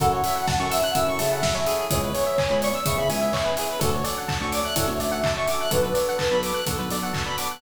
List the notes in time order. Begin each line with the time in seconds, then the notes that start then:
0.00 F#2 C#4 E4 F#4 A4 F#5, kick, closed hi-hat
0.12 C#5
0.24 C#4 E4 F#4 A4 E5, open hi-hat
0.35 F#5
0.48 A5, kick, snare
0.59 F#2 C#4 E4 F#4 A4 C#6
0.70 E5 E6, open hi-hat
0.83 F#5 F#6
0.94 F#2 C#4 E4 F#4 A4 E5 E6, kick, closed hi-hat
1.07 F#2 C#6
1.19 C#3 E5 A5, open hi-hat
1.31 C#4 E4 F#4 A4 F#5
1.42 E5, kick, snare
1.54 C#4 E4 F#4 A4 C#5
1.66 C#4 E4 F#4 G#4 A4, open hi-hat
1.90 C#2 B3 C#4 E4 G#4 C#5, kick, closed hi-hat
2.03 B4
2.13 B3 C#4 E4 G#4 C#5, open hi-hat
2.26 E5
2.38 G#5, kick, clap
2.50 C#2 B3 C#4 E4 G#4 B5
2.62 D5 C#6, open hi-hat
2.74 E6
2.86 C#3 B3 C#4 E4 G#4 E5 C#6, kick, closed hi-hat
2.98 C#3 B5
3.09 C#2 E5 G#5, open hi-hat
3.21 B3 C#4 E4 G#4 E5
3.33 C#5, kick, clap
3.44 B3 C#4 E4 G#4 B4
3.57 B3 C#4 E4 G#4, open hi-hat
3.69 B4
3.79 D2 C#4 D4 F#4 A4 F#5, kick, closed hi-hat
3.94 C#5
4.04 C#4 D4 F#4 A4 D5, open hi-hat
4.17 F#5
4.28 A5, kick, clap
4.40 D2 C#4 D4 F#4 A4 C#6
4.52 D5 D6, open hi-hat
4.64 E5 F#6
4.76 A2 C#4 D4 F#4 A4 E5, kick, closed hi-hat
4.87 D2 C#5
5.00 D2 D5 E5, open hi-hat
5.11 C#4 D4 F#4 A4 F#5
5.24 A5, kick, clap
5.36 C#4 D4 F#4 A4 C#6
5.47 C#4 D4 F#4 A4 D6, open hi-hat
5.61 F#6
5.71 B1 B3 D4 F#4 A4 B4, kick, closed hi-hat
5.82 B4
5.94 B3 D4 F#4 A4 D5, open hi-hat
6.08 F#5
6.18 A5, kick, clap
6.31 B1 B3 D4 F#4 A4 B5
6.43 D6, open hi-hat
6.54 F#6
6.66 B1 B3 D4 F#4 A4, kick, closed hi-hat
6.78 B1 B4
6.90 B1 D5, open hi-hat
7.02 B3 D4 F#4 A4 F#5
7.13 A5, kick, clap
7.26 B3 D4 F#4 A4 B5
7.37 B3 D4 F#4 A4 D6, open hi-hat
7.51 F#6